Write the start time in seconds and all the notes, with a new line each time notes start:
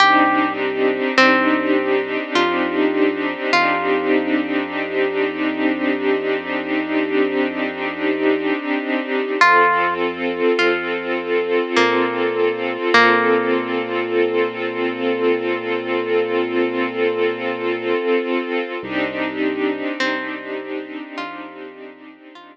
0.00 C2 C4 D4 D#4 G4
1.17 C2 C4
2.35 F2 F4
3.52 F2 F4
9.41 F2 C4 F4 A4
10.59 F2 F4
11.76 A#2 A#3
12.94 A#2 A#3
18.83 C2 C4 D4 D#4 G4
20.00 C2 C4
21.18 F2 F4
22.35 F2 F4